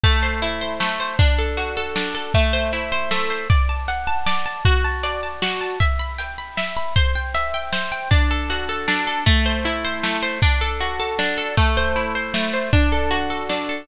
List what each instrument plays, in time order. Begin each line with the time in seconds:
0.04 orchestral harp A3, kick, closed hi-hat
0.23 orchestral harp C5
0.42 orchestral harp E4, closed hi-hat
0.61 orchestral harp C5
0.80 orchestral harp A3, snare
1.00 orchestral harp C5
1.19 orchestral harp D4, kick, closed hi-hat
1.39 orchestral harp A4
1.57 orchestral harp F#4, closed hi-hat
1.77 orchestral harp A4
1.96 orchestral harp D4, snare
2.15 orchestral harp A4
2.34 orchestral harp A3, kick, closed hi-hat
2.53 orchestral harp C5
2.73 orchestral harp E4, closed hi-hat
2.92 orchestral harp C5
3.11 orchestral harp A3, snare
3.30 orchestral harp C5
3.50 orchestral harp D5, kick, closed hi-hat
3.69 orchestral harp A5
3.88 orchestral harp F#5, closed hi-hat
4.07 orchestral harp A5
4.26 orchestral harp D5, snare
4.46 orchestral harp A5
4.65 orchestral harp F#4, kick, closed hi-hat
4.84 orchestral harp A5
5.03 orchestral harp D5, closed hi-hat
5.23 orchestral harp A5
5.42 orchestral harp F#4, snare
5.61 orchestral harp A5
5.80 orchestral harp E5, kick, closed hi-hat
5.99 orchestral harp B5
6.19 orchestral harp G5, closed hi-hat
6.38 orchestral harp B5
6.57 orchestral harp E5, snare
6.77 orchestral harp B5
6.96 orchestral harp C5, kick, closed hi-hat
7.15 orchestral harp G5
7.34 orchestral harp E5, closed hi-hat
7.54 orchestral harp G5
7.73 orchestral harp C5, snare
7.92 orchestral harp G5
8.11 orchestral harp D4, kick, closed hi-hat
8.31 orchestral harp A4
8.50 orchestral harp F#4, closed hi-hat
8.69 orchestral harp A4
8.88 orchestral harp D4, snare
9.07 orchestral harp A4
9.26 orchestral harp A3, kick, closed hi-hat
9.46 orchestral harp C5
9.65 orchestral harp E4, closed hi-hat
9.85 orchestral harp C5
10.03 orchestral harp A3, snare
10.23 orchestral harp C5
10.42 orchestral harp D4, kick, closed hi-hat
10.61 orchestral harp A4
10.80 orchestral harp F#4, closed hi-hat
11.00 orchestral harp A4
11.19 orchestral harp D4, snare
11.38 orchestral harp A4
11.57 orchestral harp A3, kick, closed hi-hat
11.77 orchestral harp C5
11.96 orchestral harp E4, closed hi-hat
12.15 orchestral harp C5
12.34 orchestral harp A3, snare
12.54 orchestral harp C5
12.73 orchestral harp D4, kick, closed hi-hat
12.92 orchestral harp A4
13.11 orchestral harp F#4, closed hi-hat
13.30 orchestral harp A4
13.49 orchestral harp D4, snare
13.69 orchestral harp A4